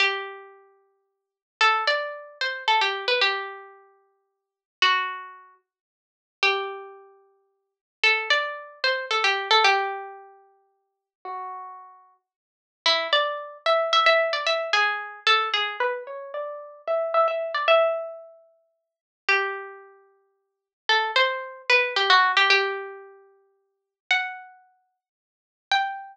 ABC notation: X:1
M:3/4
L:1/16
Q:1/4=112
K:G
V:1 name="Pizzicato Strings"
G12 | A2 d4 c2 A G2 B | G12 | F6 z6 |
G12 | A2 d4 c2 A G2 A | G12 | F8 z4 |
[K:A] E2 d4 e2 e e2 d | e2 G4 A2 G2 B2 | c2 d4 e2 e e2 d | e10 z2 |
[K:G] G12 | A2 c4 B2 G F2 G | G12 | f8 z4 |
g12 |]